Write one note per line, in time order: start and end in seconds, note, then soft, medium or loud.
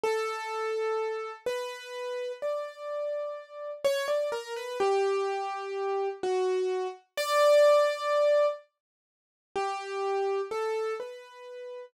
0.03 1.32 A4 loud
1.46 2.32 B4 medium
2.42 3.71 D5 medium
3.85 4.06 C#5 loud
4.08 4.29 D5 medium
4.32 4.53 A#4 medium
4.56 4.78 B4 medium
4.80 6.09 G4 loud
6.23 6.88 F#4 medium
7.17 8.46 D5 loud
9.56 10.41 G4 medium
10.51 10.94 A4 medium
11.00 11.85 B4 soft